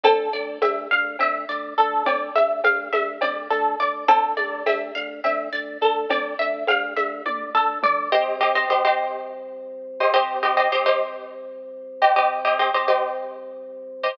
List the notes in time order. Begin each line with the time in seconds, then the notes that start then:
0.03 D2 A4, cowbell, low conga, shaker
0.33 D2 D5, shaker
0.62 D2 E5, cowbell, high conga, shaker
0.91 D2 F5, shaker
1.19 D2 E5, cowbell, low conga, shaker
1.49 D2 D5, shaker
1.77 D2 A4, shaker
2.05 D2 D5, cowbell, low conga, shaker
2.35 D2 E5, high conga, shaker
2.64 D2 F5, cowbell, high conga, shaker
2.93 D2 E5, high conga, shaker
3.21 D2 D5, cowbell, low conga, shaker
3.50 D2 A4, shaker
3.79 D2 D5, shaker
4.08 D2 A4, cowbell, low conga, shaker
4.37 D2 D5, high conga, shaker
4.66 D2 E5, cowbell, high conga, shaker
4.95 D2 F5, shaker
5.24 D2 E5, cowbell, low conga, shaker
5.53 D2 D5, shaker
5.81 D2 A4, shaker
6.09 D2 D5, cowbell, low conga, shaker
6.39 D2 E5, shaker
6.67 D2 F5, cowbell, high conga, shaker
6.96 D2 E5, high conga, shaker
7.26 D2 D5, kick, high tom
7.55 D2 A4, floor tom
7.83 D2 D5, mid tom
8.12 C2 G4 C5 D#5
8.41 G4 C5 D#5
8.55 G4 C5 D#5
8.69 C2 G4 C5 D#5
8.85 G4 C5 D#5
10.00 G4 C5 D#5
10.14 C2 G4 C5 D#5
10.43 G4 C5 D#5
10.57 G4 C5 D#5
10.72 C2 G4 C5 D#5
10.86 G4 C5 D#5
12.02 G4 C5 D#5
12.16 C2 G4 C5 D#5
12.45 G4 C5 D#5
12.59 G4 C5 D#5
12.74 C2 G4 C5 D#5
12.88 G4 C5 D#5
14.03 G4 C5 D#5